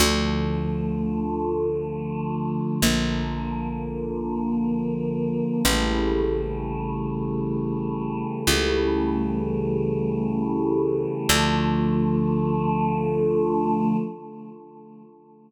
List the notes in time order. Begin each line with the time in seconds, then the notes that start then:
0.00 D2 D3 F3 A3
2.82 A#1 D3 F3 A#3
5.65 A1 C#3 E3 G3 A3
8.47 C#2 C#3 E3 G3 A3
11.29 D2 D3 F3 A3